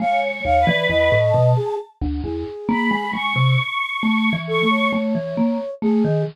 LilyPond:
<<
  \new Staff \with { instrumentName = "Vibraphone" } { \time 7/8 \tempo 4 = 67 aes8 ees,16 e16 e,16 a,16 b,16 r8 d,16 e,16 r16 bes16 aes16 | aes16 c16 r8 \tuplet 3/2 { a8 e8 a8 } a16 e16 bes16 r16 a16 ees16 | }
  \new Staff \with { instrumentName = "Flute" } { \time 7/8 f''16 r16 f''16 d''16 ees''8. aes'16 r8 aes'4 | r4. a'16 des''4~ des''16 aes'8 | }
  \new Staff \with { instrumentName = "Choir Aahs" } { \time 7/8 \tuplet 3/2 { des''4 b'4 a''4 } r4 b''8 | des'''4. des'''8 r4. | }
>>